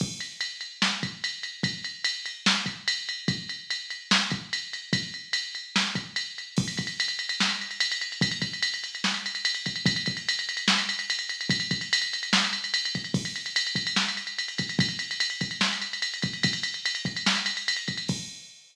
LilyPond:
\new DrumStaff \drummode { \time 4/4 \tempo 4 = 146 <cymc bd>8 cymr8 cymr8 cymr8 sn8 <bd cymr>8 cymr8 cymr8 | <bd cymr>8 cymr8 cymr8 cymr8 sn8 <bd cymr>8 cymr8 cymr8 | <bd cymr>8 cymr8 cymr8 cymr8 sn8 <bd cymr>8 cymr8 cymr8 | <bd cymr>8 cymr8 cymr8 cymr8 sn8 <bd cymr>8 cymr8 cymr8 |
<cymc bd>16 cymr16 <bd cymr>16 cymr16 cymr16 cymr16 cymr16 cymr16 sn16 cymr16 cymr16 cymr16 cymr16 cymr16 cymr16 cymr16 | <bd cymr>16 cymr16 <bd cymr>16 cymr16 cymr16 cymr16 cymr16 cymr16 sn16 cymr16 cymr16 cymr16 cymr16 cymr16 <bd cymr>16 cymr16 | <bd cymr>16 cymr16 <bd cymr>16 cymr16 cymr16 cymr16 cymr16 cymr16 sn16 cymr16 cymr16 cymr16 cymr16 cymr16 cymr16 cymr16 | <bd cymr>16 cymr16 <bd cymr>16 cymr16 cymr16 cymr16 cymr16 cymr16 sn16 cymr16 cymr16 cymr16 cymr16 cymr16 <bd cymr>16 cymr16 |
<cymc bd>16 cymr16 cymr16 cymr16 cymr16 cymr16 <bd cymr>16 cymr16 sn16 cymr16 cymr16 cymr16 cymr16 cymr16 <bd cymr>16 cymr16 | <bd cymr>16 cymr16 cymr16 cymr16 cymr16 cymr16 <bd cymr>16 cymr16 sn16 cymr16 cymr16 cymr16 cymr16 cymr16 <bd cymr>16 cymr16 | <bd cymr>16 cymr16 cymr16 cymr16 cymr16 cymr16 <bd cymr>16 cymr16 sn16 cymr16 cymr16 cymr16 cymr16 cymr16 <bd cymr>16 cymr16 | <cymc bd>4 r4 r4 r4 | }